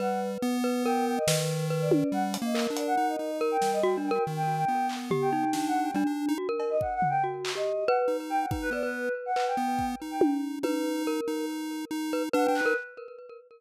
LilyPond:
<<
  \new Staff \with { instrumentName = "Choir Aahs" } { \time 5/4 \tempo 4 = 141 fis''8 r4. g''8 g''16 dis''8 r4 d''16 d''8 | fis''16 r8 dis''8 r16 d''16 fis''8 dis''8. r16 g''8 dis''16 g''16 r16 g''16 g''16 | r16 g''8 g''8. r8. g''8. \tuplet 3/2 { g''8 fis''8 g''8 } r4 | r8. dis''16 \tuplet 3/2 { fis''8 fis''8 g''8 } r8. dis''8. fis''16 r8. g''16 fis''16 |
r16 b'16 d''16 b'8. r16 fis''8 g''4 r8 g''8 r8. | r1 fis''16 g''16 b'8 | }
  \new Staff \with { instrumentName = "Glockenspiel" } { \time 5/4 b'4. b'8 ais'4 b'4 b'4 | r4 ais'2 ais'4 \tuplet 3/2 { fis'8 d'8 ais'8 } | r2 g'8 dis'4. d'4 | fis'16 ais'8. r4 fis'8. g'8. b'8. r8. |
r8 b'16 b'4~ b'16 b'8 r2 r8 | b'4 ais'4 r4. b'16 r16 b'8. ais'16 | }
  \new Staff \with { instrumentName = "Lead 1 (square)" } { \time 5/4 g4 b2 dis2 | \tuplet 3/2 { g4 ais4 d'4 } dis'8 dis'4 g4. | dis4 b2 d'4 g16 d'8 dis'16 | r1 dis'4 |
dis'8 b4 r4 b4 dis'4. | dis'4. dis'4. dis'4 \tuplet 3/2 { d'8 d'8 dis'8 } | }
  \new DrumStaff \with { instrumentName = "Drums" } \drummode { \time 5/4 r4 r4 r4 sn4 r8 tommh8 | r8 hh8 hc8 hh8 r4 r8 sn8 r4 | r4 r8 hc8 tomfh4 sn4 r4 | r8 cb8 bd8 tomfh8 r8 hc8 r4 r4 |
bd4 r4 hc4 bd4 tommh4 | tommh4 r4 r4 r4 r8 hc8 | }
>>